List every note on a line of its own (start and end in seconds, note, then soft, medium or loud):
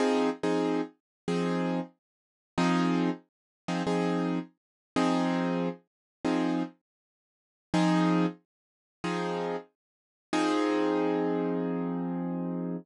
0.00 0.30 F3 medium
0.00 0.30 C4 medium
0.00 0.30 D#4 medium
0.00 0.30 G#4 medium
0.43 0.81 F3 medium
0.43 0.81 C4 medium
0.43 0.81 D#4 medium
0.43 0.81 G#4 medium
1.28 1.80 F3 medium
1.28 1.80 C4 medium
1.28 1.80 D#4 medium
1.28 1.80 G#4 medium
2.58 3.10 F3 loud
2.58 3.10 C4 medium
2.58 3.10 D#4 loud
2.58 3.10 G#4 medium
3.68 3.83 F3 medium
3.68 3.83 C4 medium
3.68 3.83 D#4 medium
3.68 3.83 G#4 medium
3.87 4.39 F3 medium
3.87 4.39 C4 medium
3.87 4.39 D#4 medium
3.87 4.39 G#4 medium
4.96 5.69 F3 medium
4.96 5.69 C4 loud
4.96 5.69 D#4 medium
4.96 5.69 G#4 medium
6.25 6.63 F3 medium
6.25 6.63 C4 medium
6.25 6.63 D#4 medium
6.25 6.63 G#4 medium
7.74 8.26 F3 loud
7.74 8.26 C4 medium
7.74 8.26 D#4 loud
7.74 8.26 G#4 loud
9.04 9.56 F3 medium
9.04 9.56 C4 medium
9.04 9.56 D#4 medium
9.04 9.56 G#4 medium
10.33 12.76 F3 medium
10.33 12.76 C4 loud
10.33 12.76 D#4 loud
10.33 12.76 G#4 loud